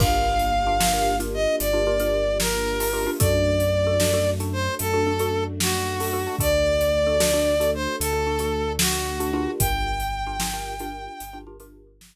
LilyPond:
<<
  \new Staff \with { instrumentName = "Brass Section" } { \time 12/8 \key g \minor \tempo 4. = 75 f''2~ f''8 ees''8 d''4. bes'4. | d''2~ d''8 c''8 a'4. fis'4. | d''2~ d''8 c''8 a'4. fis'4. | g''1 r2 | }
  \new Staff \with { instrumentName = "Xylophone" } { \time 12/8 \key g \minor <d' f' g' bes'>4~ <d' f' g' bes'>16 <d' f' g' bes'>16 <d' f' g' bes'>16 <d' f' g' bes'>8 <d' f' g' bes'>4 <d' f' g' bes'>16 <d' f' g' bes'>16 <d' f' g' bes'>4. <d' f' g' bes'>16 <d' f' g' bes'>16 <d' f' g' bes'>16 | <d' fis' a'>4~ <d' fis' a'>16 <d' fis' a'>16 <d' fis' a'>16 <d' fis' a'>8 <d' fis' a'>4 <d' fis' a'>16 <d' fis' a'>16 <d' fis' a'>4. <d' fis' a'>16 <d' fis' a'>16 <d' fis' a'>16 | <d' fis' a'>4~ <d' fis' a'>16 <d' fis' a'>16 <d' fis' a'>16 <d' fis' a'>8 <d' fis' a'>4 <d' fis' a'>16 <d' fis' a'>16 <d' fis' a'>4. <d' fis' a'>16 <d' f' g' bes'>8~ | <d' f' g' bes'>4~ <d' f' g' bes'>16 <d' f' g' bes'>16 <d' f' g' bes'>16 <d' f' g' bes'>8 <d' f' g' bes'>4 <d' f' g' bes'>16 <d' f' g' bes'>16 <d' f' g' bes'>4. r8. | }
  \new Staff \with { instrumentName = "Synth Bass 2" } { \clef bass \time 12/8 \key g \minor g,,2. g,,2. | fis,2. fis,2. | d,2. d,2. | g,,2. g,,2. | }
  \new Staff \with { instrumentName = "String Ensemble 1" } { \time 12/8 \key g \minor <bes d' f' g'>1. | <a d' fis'>1. | <a d' fis'>1. | r1. | }
  \new DrumStaff \with { instrumentName = "Drums" } \drummode { \time 12/8 <cymc bd>8. hh8. sn8. hh8. hh8. hh8. sn8. hho8. | <hh bd>8. hh8. sn8. hh8. hh8. hh8. sn8. hho8. | <hh bd>8. hh8. sn8. hh8. hh8. hh8. sn8. hh8. | <hh bd>8. hh8. sn8. hh8. hh8. hh8. sn4. | }
>>